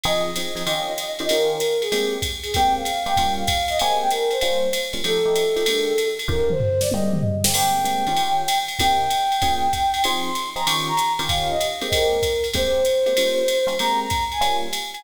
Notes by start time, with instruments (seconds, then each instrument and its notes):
0.03 electric piano 1 F3 C4 D#4 G#4, flute D#5, ride
0.36 electric piano 1 F3 C4 D#4 G#4, hi-hat pedal, ride
0.55 electric piano 1 F3 C4 D#4 G#4, ride
0.66 electric piano 1 D#3 C#4 F4 G4, ride
0.98 hi-hat pedal, ride
1.19 electric piano 1 D#3 C#4 F4 G4, ride
1.29 electric piano 1 D#3 C#4 F4 G4, flute A#4, ride
1.50 flute A#4
1.60 hi-hat pedal, ride
1.81 flute G#4, ride
1.92 electric piano 1 G#3 A#3 C4 G4, ride
2.22 kick, hi-hat pedal, ride
2.43 flute G#4, ride
2.54 electric piano 1 G#3 A#3 C4 G4, flute G5, kick, ride
2.75 flute F5
2.85 hi-hat pedal, ride
3.06 electric piano 1 G#3 A#3 C4 G4, flute G5, ride
3.17 electric piano 1 G3 A#3 C#4 F4, kick, ride
3.37 flute F5
3.47 kick, hi-hat pedal, ride
3.68 flute D#5, ride
3.79 electric piano 1 G#3 A#3 C4 G4, flute G#5, ride
4.00 flute G5
4.10 flute A#4, hi-hat pedal, ride
4.31 flute C5, ride
4.41 electric piano 1 G3 A#3 C#4 F4, ride
4.73 hi-hat pedal, ride
4.93 electric piano 1 G3 A#3 C#4 F4, ride
5.04 electric piano 1 F3 A3 D#4 G4, flute A4, ride
5.25 electric piano 1 F3 A3 D#4 G4
5.35 hi-hat pedal, ride
5.56 electric piano 1 F3 A3 D#4 G4, ride
5.66 electric piano 1 D3 G#3 A#3 G4, ride
5.98 hi-hat pedal, ride
6.19 ride
6.28 electric piano 1 D#3 C#4 F4 G4, flute A#4, kick
6.50 flute C5, mid tom
6.60 floor tom
6.81 flute D5, snare
6.91 electric piano 1 G#3 A#3 C4 G4, flute D#5, high tom
7.13 mid tom
7.23 floor tom
7.44 electric piano 1 G#3 A#3 C4 G4, snare
7.54 electric piano 1 G#3 A#3 C4 G4, flute G5, crash, ride
7.84 electric piano 1 G#3 A#3 C4 G4, hi-hat pedal, ride
8.07 electric piano 1 D#3 C#4 F4 G4, ride
8.17 ride
8.48 hi-hat pedal, ride
8.68 ride
8.79 electric piano 1 C3 A#3 D#4 G4, flute G5, kick, ride
9.10 hi-hat pedal, ride
9.32 ride
9.42 electric piano 1 A#3 C#4 F4 G#4, kick, ride
9.73 kick, hi-hat pedal, ride
9.94 ride
10.04 electric piano 1 F3 C4 D#4 G#4, flute C6, ride
10.35 hi-hat pedal, ride
10.56 electric piano 1 F3 C4 D#4 G#4, flute A#5, ride
10.67 electric piano 1 D#3 C#4 F4 G4, flute C#6, ride
10.88 flute A#5
10.97 hi-hat pedal, ride
11.19 electric piano 1 D#3 C#4 F4 G4, ride
11.29 flute F5, kick, ride
11.50 flute D#5
11.60 hi-hat pedal, ride
11.81 electric piano 1 G#3 A#3 C4 G4, ride
11.92 flute A#4, kick, ride
12.23 kick, hi-hat pedal, ride
12.44 ride
12.53 electric piano 1 G#3 A#3 C4 G4, flute C5, kick, ride
12.85 hi-hat pedal, ride
13.06 electric piano 1 G#3 A#3 C4 G4, ride
13.17 electric piano 1 G3 A#3 C#4 F4, ride
13.48 hi-hat pedal, ride
13.67 electric piano 1 G3 A#3 C#4 F4, ride
13.79 electric piano 1 G#3 A#3 C4 G4, flute A#5, ride
14.00 flute A#5
14.10 kick, hi-hat pedal, ride
14.32 flute G#5, ride
14.41 electric piano 1 G3 A#3 C#4 F4, ride
14.73 hi-hat pedal, ride
14.94 flute G#5, ride